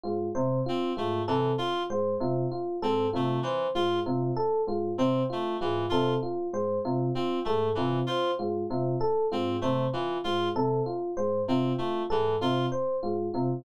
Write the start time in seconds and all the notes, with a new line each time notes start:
0.03 G#2 F4
0.35 C3 C5
0.66 C4 F4
0.97 G#2 A3 F4
1.27 C3 E3 A4
1.58 F4
1.90 G#2 C5
2.20 C3 F4
2.52 F4
2.82 G#2 C4 A4
3.13 C3 A3 F4
3.43 E3 C5
3.75 G#2 F4
4.06 C3 F4
4.36 A4
4.67 G#2 F4
4.98 C3 C4 C5
5.30 A3 F4
5.61 G#2 E3 F4
5.89 C3 F4 A4
6.23 F4
6.53 G#2 C5
6.85 C3 F4
7.15 C4 F4
7.45 G#2 A3 A4
7.75 C3 E3 F4
8.06 F4 C5
8.39 G#2 F4
8.70 C3 F4
9.01 A4
9.32 G#2 C4 F4
9.61 C3 A3 C5
9.93 E3 F4
10.24 G#2 F4
10.56 C3 A4
10.86 F4
11.17 G#2 C5
11.48 C3 C4 F4
11.78 A3 F4
12.10 G#2 E3 A4
12.41 C3 F4
12.72 C5
13.03 G#2 F4
13.34 C3 F4